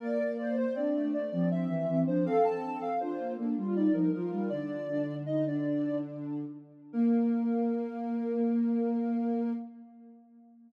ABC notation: X:1
M:3/4
L:1/16
Q:1/4=80
K:Bb
V:1 name="Ocarina"
B B d c d2 d d =e3 c | f a2 f c2 z2 d B B B | "^rit." d4 e d3 z4 | B12 |]
V:2 name="Ocarina"
d2 c c D3 C C C C D | A4 F2 D F E E F2 | "^rit." D2 D2 E D5 z2 | B,12 |]
V:3 name="Ocarina"
B,4 C A, A, F,2 =E, E, F, | C4 D B, B, G,2 F, F, G, | "^rit." D,10 z2 | B,12 |]